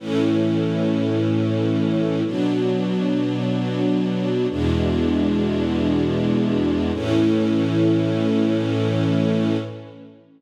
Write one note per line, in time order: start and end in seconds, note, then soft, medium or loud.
0.00 2.23 A2 medium
0.00 2.23 E3 medium
0.00 2.23 C#4 medium
2.24 4.47 B2 medium
2.24 4.47 F#3 medium
2.24 4.47 D4 medium
4.50 6.92 E2 medium
4.50 6.92 B2 medium
4.50 6.92 G#3 medium
4.50 6.92 D4 medium
6.93 9.57 A2 loud
6.93 9.57 E3 medium
6.93 9.57 C#4 loud